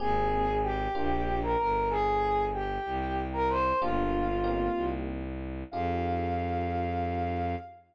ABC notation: X:1
M:6/8
L:1/16
Q:3/8=63
K:Fdor
V:1 name="Ocarina"
[Aa]4 [Gg]5 [Bb] [Bb]2 | [Aa]4 [Gg]5 [Bb] [cc']2 | [Ff]8 z4 | f12 |]
V:2 name="Electric Piano 1"
[B,CGA]6 [B,DFG]6 | z12 | [B,DFG]4 [B,CEG]8 | [EFGA]12 |]
V:3 name="Violin" clef=bass
A,,,6 B,,,4 G,,,2- | G,,,6 C,,6 | G,,,6 C,,6 | F,,12 |]